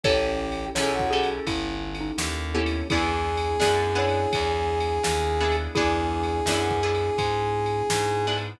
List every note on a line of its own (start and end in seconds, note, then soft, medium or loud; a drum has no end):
0.03 0.69 A1 medium
0.03 0.70 C#4 loud
0.03 2.89 C#4 medium
0.03 0.70 E4 loud
0.03 2.89 E4 medium
0.03 0.65 G4 loud
0.03 0.70 G4 loud
0.03 2.89 G4 medium
0.03 0.70 A4 loud
0.03 0.65 A4 loud
0.03 2.89 A4 medium
0.03 0.65 C#5 loud
0.03 kick loud
0.03 ride loud
0.52 ride medium
0.75 1.39 B1 medium
0.75 1.10 C#4 loud
0.75 1.10 E4 loud
0.75 1.10 G4 medium
0.75 0.93 G#4 loud
0.75 1.10 A4 medium
0.75 1.09 C#5 medium
0.75 snare loud
0.93 1.28 F#4 loud
0.99 kick medium
1.11 2.44 C#4 medium
1.11 2.44 E4 medium
1.11 2.44 G4 medium
1.11 1.44 G#4 loud
1.11 2.44 A4 medium
1.23 ride medium
1.47 2.11 G1 loud
1.47 1.95 E4 medium
1.47 kick medium
1.47 ride loud
1.95 ride medium
2.01 2.49 D#4 medium
2.18 2.82 D#2 medium
2.18 snare loud
2.54 2.86 B3 medium
2.54 2.87 C#4 medium
2.54 2.87 E4 medium
2.54 2.87 G4 medium
2.54 2.87 A4 medium
2.66 ride medium
2.89 3.56 E2 loud
2.89 5.72 B3 medium
2.89 3.57 B3 loud
2.89 5.72 D4 medium
2.89 3.57 D4 medium
2.89 5.72 E4 medium
2.89 3.48 E4 medium
2.89 3.57 E4 medium
2.89 5.72 G#4 medium
2.89 5.56 G#4 loud
2.89 3.48 G#4 medium
2.89 3.57 G#4 medium
2.89 kick loud
2.89 ride loud
3.37 ride medium
3.60 4.26 F#2 medium
3.60 3.92 B3 medium
3.60 3.92 D4 medium
3.60 3.92 E4 medium
3.60 3.92 G#4 medium
3.60 snare loud
3.95 5.27 B3 medium
3.95 5.27 D4 medium
3.95 5.27 E4 medium
3.95 5.27 G#4 medium
3.95 5.58 C#5 medium
4.09 ride medium
4.33 4.99 E2 medium
4.33 kick medium
4.33 ride loud
4.80 ride medium
5.03 5.68 D#2 medium
5.03 snare loud
5.40 5.73 B3 medium
5.40 5.73 D4 medium
5.40 5.73 E4 medium
5.40 5.73 G#4 medium
5.52 ride medium
5.75 6.40 E2 loud
5.75 8.60 B3 medium
5.75 6.43 B3 loud
5.75 8.60 D4 medium
5.75 6.43 D4 loud
5.75 6.70 E4 loud
5.75 8.60 E4 medium
5.75 6.43 E4 loud
5.75 6.70 G#4 loud
5.75 8.37 G#4 loud
5.75 8.60 G#4 medium
5.75 6.43 G#4 loud
5.75 kick loud
5.75 ride medium
6.23 ride medium
6.46 7.10 F#2 medium
6.46 6.80 B3 medium
6.46 6.80 D4 medium
6.46 6.80 E4 medium
6.46 6.80 G#4 medium
6.46 snare loud
6.71 kick medium
6.83 8.14 B3 medium
6.83 8.14 D4 medium
6.83 8.14 E4 medium
6.83 8.14 G#4 medium
6.95 ride medium
7.18 7.82 G#2 medium
7.18 kick medium
7.18 ride loud
7.66 ride medium
7.90 8.55 G#2 medium
7.90 snare loud
8.27 8.60 B3 loud
8.27 8.60 D4 medium
8.27 8.60 E4 medium
8.27 8.60 G#4 medium
8.38 ride medium